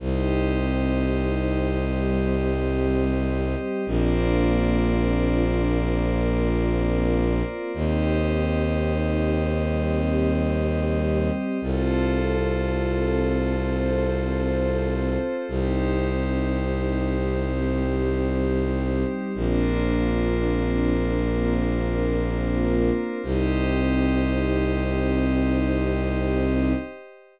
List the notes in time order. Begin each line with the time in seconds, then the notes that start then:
0.00 C2 C4 D#4 G4 C5 D#5
1.94 G3 C4 G4
3.86 A#1 A#3 C4 D4 F4 A#4 C5 D5
5.80 A#3 C4 F4 A#4
7.74 D#2 C4 D#4 G4 C5 D#5
9.68 G3 C4 G4
11.61 C2 C4 F4 A4 C5
13.55 C4 A4 C5
15.48 C2 C4 D#4 G4 C5
17.42 G3 C4 G4
19.35 A#1 A#3 C4 D4 F4 A#4 C5
21.29 A#3 C4 F4 A#4
23.23 C2 C4 D#4 G4 C5 D#5